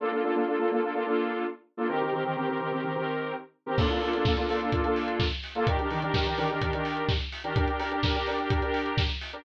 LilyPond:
<<
  \new Staff \with { instrumentName = "Lead 2 (sawtooth)" } { \time 4/4 \key bes \major \tempo 4 = 127 <bes d' f' a'>16 <bes d' f' a'>16 <bes d' f' a'>16 <bes d' f' a'>16 <bes d' f' a'>16 <bes d' f' a'>16 <bes d' f' a'>16 <bes d' f' a'>16 <bes d' f' a'>16 <bes d' f' a'>4. <bes d' f' a'>16 | <ees c' g' bes'>16 <ees c' g' bes'>16 <ees c' g' bes'>16 <ees c' g' bes'>16 <ees c' g' bes'>16 <ees c' g' bes'>16 <ees c' g' bes'>16 <ees c' g' bes'>16 <ees c' g' bes'>16 <ees c' g' bes'>4. <ees c' g' bes'>16 | <bes d' f' a'>16 <bes d' f' a'>16 <bes d' f' a'>16 <bes d' f' a'>16 <bes d' f' a'>16 <bes d' f' a'>16 <bes d' f' a'>16 <bes d' f' a'>16 <bes d' f' a'>16 <bes d' f' a'>4. <bes d' f' a'>16 | <ees d' g' bes'>16 <ees d' g' bes'>16 <ees d' g' bes'>16 <ees d' g' bes'>16 <ees d' g' bes'>16 <ees d' g' bes'>16 <ees d' g' bes'>16 <ees d' g' bes'>16 <ees d' g' bes'>16 <ees d' g' bes'>4. <ees d' g' bes'>16 |
<d' g' bes'>16 <d' g' bes'>16 <d' g' bes'>16 <d' g' bes'>16 <d' g' bes'>16 <d' g' bes'>16 <d' g' bes'>16 <d' g' bes'>16 <d' g' bes'>16 <d' g' bes'>4. <d' g' bes'>16 | }
  \new DrumStaff \with { instrumentName = "Drums" } \drummode { \time 4/4 r4 r4 r4 r4 | r4 r4 r4 r4 | <cymc bd>16 hh16 hho16 hh16 <bd sn>16 hh16 hho16 hh16 <hh bd>16 hh16 hho16 hh16 <bd sn>16 hh16 hho16 hh16 | <hh bd>16 hh16 hho16 hh16 <bd sn>16 hh16 hho16 hh16 <hh bd>16 hh16 hho16 hh16 <bd sn>16 hh16 hho16 hh16 |
<hh bd>16 hh16 hho16 hh16 <bd sn>16 hh16 hho16 hh16 <hh bd>16 hh16 hho16 hh16 <bd sn>16 hh16 hho16 hh16 | }
>>